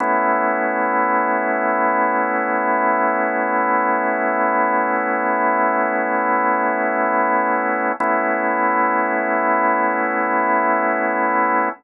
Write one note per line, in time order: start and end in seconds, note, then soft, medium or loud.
0.00 7.92 A3 loud
0.00 7.92 B3 loud
0.00 7.92 C#4 loud
0.00 7.92 E4 loud
8.00 11.69 A3 loud
8.00 11.69 B3 loud
8.00 11.69 C#4 loud
8.00 11.69 E4 loud